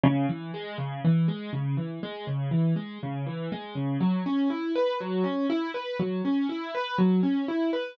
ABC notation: X:1
M:4/4
L:1/8
Q:1/4=121
K:B
V:1 name="Acoustic Grand Piano"
C, E, G, C, E, G, C, E, | G, C, E, G, C, E, G, C, | F, C E B F, C E B | F, C E B F, C E B |]